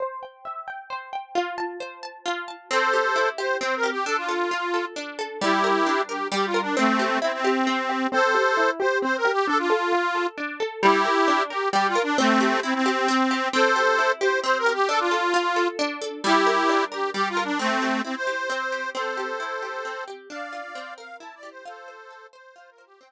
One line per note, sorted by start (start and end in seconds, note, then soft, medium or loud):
0.00 0.90 C5 medium
0.23 0.67 G5 medium
0.45 1.31 E5 medium
0.68 1.12 G5 medium
0.90 1.33 C5 medium
1.13 1.34 G5 medium
1.35 2.25 F4 medium
1.58 2.03 A5 medium
1.80 2.66 C5 medium
2.03 2.48 A5 medium
2.26 2.68 F4 medium
2.48 2.69 A5 soft
2.71 3.60 C4 medium
2.71 3.29 A4 medium
2.71 3.29 C5 medium
2.93 3.38 G4 medium
3.16 4.01 E4 medium
3.38 3.83 G4 medium
3.38 3.57 C5 medium
3.61 4.04 C4 medium
3.61 3.75 C5 medium
3.76 3.90 A#4 medium
3.83 4.05 G4 medium
3.91 4.05 G4 medium
4.06 4.96 D4 medium
4.06 4.17 A4 medium
4.17 4.85 F4 medium
4.29 4.73 A4 medium
4.51 5.37 F4 medium
4.74 5.18 A4 medium
4.96 5.39 D4 medium
5.19 5.40 A4 medium
5.41 6.31 G3 medium
5.41 6.02 E4 medium
5.41 6.02 G4 medium
5.64 6.08 A#4 medium
5.86 6.72 D4 medium
6.09 6.28 G4 medium
6.09 6.54 A#4 medium
6.32 6.74 G3 medium
6.32 6.46 G4 medium
6.47 6.61 F4 medium
6.54 6.76 A#4 medium
6.62 6.76 D4 medium
6.77 7.19 A3 medium
6.77 7.66 C4 medium
6.77 7.19 C4 medium
6.99 7.44 G4 medium
7.22 7.32 C4 medium
7.22 8.08 E4 medium
7.33 8.07 C4 medium
7.44 7.89 G4 medium
7.67 8.10 C4 medium
7.89 8.11 G4 medium
8.12 8.34 C4 loud
8.12 8.70 A4 medium
8.12 8.70 C5 loud
8.35 8.57 G4 medium
8.57 8.80 E4 medium
8.80 9.02 G4 medium
8.80 8.98 C5 medium
9.02 9.25 C4 medium
9.02 9.17 C5 medium
9.17 9.32 A#4 medium
9.25 9.46 G4 medium
9.32 9.47 G4 medium
9.47 9.70 D4 medium
9.47 9.58 A4 loud
9.59 10.27 F4 medium
9.70 9.92 A4 medium
9.92 10.15 F4 medium
10.15 10.38 A4 medium
10.38 10.60 D4 medium
10.60 10.81 A4 medium
10.83 11.05 G3 loud
10.83 11.43 E4 medium
10.83 11.43 G4 loud
11.05 11.28 A#4 medium
11.28 11.50 D4 medium
11.50 11.69 G4 medium
11.50 11.73 A#4 medium
11.73 11.96 G3 medium
11.73 11.87 G4 medium
11.88 12.02 F4 medium
11.95 12.17 A#4 medium
12.03 12.17 D4 medium
12.18 12.60 A3 medium
12.18 12.60 C4 loud
12.18 12.41 C4 medium
12.41 12.63 G4 medium
12.63 12.74 C4 medium
12.63 12.86 E4 medium
12.74 13.48 C4 medium
12.86 13.08 G4 medium
13.08 13.31 C4 medium
13.31 13.52 G4 medium
13.53 14.43 C4 medium
13.53 14.12 A4 medium
13.53 14.12 C5 loud
13.76 14.20 G4 medium
13.99 14.84 E4 medium
14.21 14.66 G4 medium
14.21 14.40 C5 medium
14.44 14.86 C4 medium
14.44 14.58 C5 medium
14.59 14.73 A#4 loud
14.66 14.88 G4 medium
14.74 14.88 G4 medium
14.89 15.78 D4 medium
14.89 14.99 A4 loud
15.00 15.68 F4 medium
15.11 15.56 A4 medium
15.34 16.20 F4 medium
15.56 16.01 A4 medium
15.79 16.22 D4 medium
16.02 16.23 A4 medium
16.24 17.14 G3 medium
16.24 16.84 E4 loud
16.24 16.84 G4 loud
16.47 16.91 A#4 medium
16.69 17.55 D4 medium
16.92 17.10 G4 medium
16.92 17.36 A#4 medium
17.14 17.57 G3 medium
17.14 17.29 G4 loud
17.29 17.44 F4 loud
17.37 17.58 A#4 medium
17.44 17.59 D4 medium
17.59 18.02 A3 loud
17.59 18.49 C4 medium
17.59 18.02 C4 loud
17.82 18.27 G4 medium
18.05 18.15 C4 medium
18.05 18.90 E4 medium
18.16 18.90 C5 loud
18.27 18.72 G4 medium
18.50 18.92 C4 medium
18.72 18.94 G4 medium
18.95 19.84 C4 medium
18.95 20.04 A4 medium
18.95 20.04 C5 medium
19.17 19.62 G4 medium
19.40 20.26 E4 medium
19.63 20.07 G4 medium
19.85 20.28 C4 medium
20.08 20.29 G4 medium
20.30 20.73 D4 medium
20.30 20.94 D5 medium
20.30 20.94 F5 medium
20.53 20.74 F4 medium
20.75 21.61 C4 medium
20.98 21.62 A#4 medium
20.98 21.17 F5 medium
21.20 21.63 E4 medium
21.20 21.35 A5 medium
21.35 21.50 D5 medium
21.43 21.64 G4 medium
21.50 21.65 C5 medium
21.65 22.55 F4 medium
21.65 22.27 A4 medium
21.65 22.27 C5 medium
21.88 22.33 C5 medium
22.10 22.96 A4 medium
22.33 22.78 C5 medium
22.33 22.55 C5 medium
22.56 22.99 F4 medium
22.56 22.70 C5 medium
22.71 22.85 A#4 medium
22.78 23.00 C5 medium
22.86 23.00 G4 medium
23.01 23.12 C4 medium
23.01 23.12 G5 medium